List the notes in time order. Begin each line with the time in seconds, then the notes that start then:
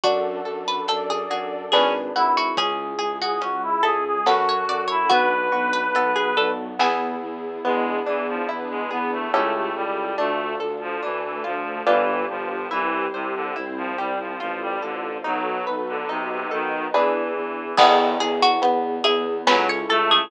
0.04 F#2 D4 F#4 A4, kick, closed hi-hat
0.45 F#2 A4
0.68 B4
0.88 F#2 D4 A4 D5, closed hi-hat
1.10 G#4
1.30 F#2 F#4 G#4
1.72 G#1 C#4 D4 G#4 B4, snare
2.15 G#1 E4 F#4
2.37 F#4
2.57 C#2 C#4 E4 G#4, kick, closed hi-hat
2.99 C#2 G#4
3.21 F#4 G#4
3.41 C#2 G#3 C#4 F#4 G#4, closed hi-hat
3.63 E4
3.83 C#2 E4 G#4 A4
4.05 G#4
4.26 F#2 C#4 F#4 A4 B4, snare
4.49 C#5
4.68 F#2 D5
4.88 E4 C#5
5.10 B1 B3 D4 F#4 B4, kick, closed hi-hat
5.52 B1 F#4
5.73 B4
5.95 B1 F#3 B3 F#4 A4, closed hi-hat
6.16 G#4
6.37 B1 D4 A4
6.79 E2 B3 E4 G#4, snare
7.22 E2
7.64 E2 G#3 B3 D4 E4 G#4
8.06 E2 E3 D4
8.28 F3
8.49 E2 B3 D4 E4 G#4 B4
8.70 G#3
8.91 E2 B3 G#4
9.12 A3
9.33 C#2 A3 C#4 E4 G4 A4
9.54 A3
9.75 C#2 G3
10.18 D2 A3 D4 F4 A4
10.60 D2 A4
10.81 F3
11.02 D2 E3 A3 D4 A4
11.23 E3
11.44 D2 F3 F4
11.86 G1 E3 D4 F4 G4 B4
12.29 G1 F3
12.71 C2 E3 E4 G4 C5
13.13 C2 C3 C5
13.35 D3
13.56 C2 C4 E4 C5
13.77 F3
13.98 C2 G3 G4
14.19 F3
14.40 A1 F3 F4 A4 C5
14.61 G3
14.82 A1 D3 A4
15.24 B1 F#3 D#4 F#4 A4 B4
15.67 B1 B4
15.88 D3
16.09 B1 C3 D#4 F#4 B4 D#5
16.30 C3
16.51 B1 D#3 A4
16.94 E2 E3 D4 E4 G#4 B4
17.36 E2
17.77 E2 B3 E4 G#4, kick, crash
18.20 E2 G#4
18.42 F#4
18.62 E2 B3 G#4 B4, closed hi-hat
19.04 E2 E4 G#4
19.47 C#2 F#3 C#4 E4 A4 B4, snare
19.69 C#5
19.90 C#2 A3 A4
20.11 G#4